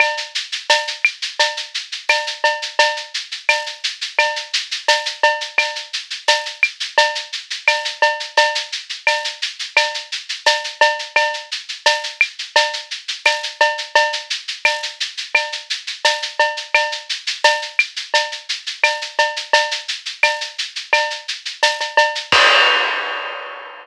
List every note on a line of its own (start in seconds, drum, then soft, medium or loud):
0.00 cowbell medium
0.00 claves loud
0.00 shaker loud
0.17 shaker medium
0.35 shaker medium
0.52 shaker medium
0.69 tambourine medium
0.69 cowbell medium
0.69 shaker loud
0.87 shaker medium
1.05 claves loud
1.05 shaker medium
1.22 shaker medium
1.39 cowbell medium
1.39 shaker loud
1.57 shaker medium
1.74 shaker medium
1.92 shaker medium
2.09 tambourine medium
2.09 cowbell medium
2.09 claves loud
2.09 shaker loud
2.27 shaker medium
2.44 cowbell medium
2.44 shaker medium
2.62 shaker medium
2.79 cowbell medium
2.79 shaker loud
2.97 shaker medium
3.14 shaker medium
3.32 shaker medium
3.49 tambourine medium
3.49 cowbell medium
3.49 claves medium
3.49 shaker loud
3.66 shaker medium
3.84 shaker medium
4.01 shaker medium
4.19 cowbell medium
4.19 claves medium
4.19 shaker loud
4.36 shaker medium
4.53 shaker loud
4.71 shaker medium
4.88 tambourine medium
4.88 cowbell medium
4.88 shaker loud
5.06 shaker medium
5.23 cowbell medium
5.23 shaker medium
5.41 shaker medium
5.58 cowbell medium
5.58 claves loud
5.58 shaker loud
5.76 shaker medium
5.93 shaker medium
6.10 shaker medium
6.28 tambourine medium
6.28 cowbell medium
6.28 shaker loud
6.45 shaker medium
6.63 claves medium
6.63 shaker medium
6.80 shaker medium
6.98 cowbell medium
6.98 shaker loud
7.15 shaker medium
7.33 shaker medium
7.50 shaker medium
7.67 tambourine medium
7.67 cowbell medium
7.67 claves loud
7.67 shaker loud
7.85 shaker medium
8.02 cowbell medium
8.02 shaker medium
8.20 shaker medium
8.37 cowbell loud
8.37 shaker loud
8.55 shaker medium
8.72 shaker medium
8.89 shaker medium
9.07 tambourine medium
9.07 cowbell medium
9.07 claves medium
9.07 shaker loud
9.24 shaker medium
9.42 shaker medium
9.59 shaker medium
9.77 cowbell medium
9.77 claves medium
9.77 shaker loud
9.94 shaker medium
10.12 shaker medium
10.29 shaker medium
10.46 tambourine medium
10.46 cowbell medium
10.46 shaker loud
10.64 shaker medium
10.81 cowbell medium
10.81 shaker medium
10.99 shaker medium
11.16 cowbell loud
11.16 claves loud
11.16 shaker loud
11.34 shaker medium
11.51 shaker medium
11.69 shaker medium
11.86 tambourine medium
11.86 cowbell medium
11.86 shaker loud
12.03 shaker medium
12.21 claves loud
12.21 shaker medium
12.39 shaker medium
12.56 cowbell medium
12.56 shaker loud
12.73 shaker medium
12.91 shaker medium
13.08 shaker medium
13.25 tambourine medium
13.25 cowbell medium
13.25 claves medium
13.25 shaker loud
13.43 shaker medium
13.61 cowbell medium
13.61 shaker medium
13.78 shaker medium
13.95 cowbell loud
13.95 shaker loud
14.13 shaker medium
14.30 shaker medium
14.48 shaker medium
14.65 tambourine medium
14.65 cowbell medium
14.65 claves medium
14.65 shaker loud
14.83 shaker medium
15.00 shaker medium
15.17 shaker medium
15.35 cowbell medium
15.35 claves loud
15.35 shaker loud
15.52 shaker medium
15.70 shaker medium
15.87 shaker medium
16.05 tambourine medium
16.05 cowbell medium
16.05 shaker loud
16.22 shaker medium
16.40 cowbell medium
16.40 shaker medium
16.57 shaker medium
16.74 cowbell medium
16.74 claves loud
16.74 shaker loud
16.92 shaker medium
17.09 shaker medium
17.27 shaker medium
17.44 tambourine medium
17.44 cowbell medium
17.44 shaker loud
17.62 shaker medium
17.79 claves medium
17.79 shaker medium
17.96 shaker medium
18.14 cowbell medium
18.14 shaker loud
18.32 shaker medium
18.49 shaker medium
18.66 shaker medium
18.84 tambourine medium
18.84 cowbell medium
18.84 claves medium
18.84 shaker loud
19.01 shaker medium
19.19 cowbell medium
19.19 shaker medium
19.36 shaker medium
19.53 cowbell medium
19.53 shaker loud
19.71 shaker medium
19.88 shaker medium
20.06 shaker medium
20.23 tambourine medium
20.23 cowbell medium
20.23 claves medium
20.23 shaker loud
20.41 shaker medium
20.58 shaker medium
20.76 shaker medium
20.93 cowbell loud
20.93 claves loud
20.93 shaker loud
21.10 shaker medium
21.28 shaker medium
21.45 shaker medium
21.63 tambourine medium
21.63 cowbell medium
21.63 shaker loud
21.80 cowbell medium
21.80 shaker medium
21.97 cowbell medium
21.97 shaker medium
22.15 shaker medium
22.32 kick loud
22.32 crash loud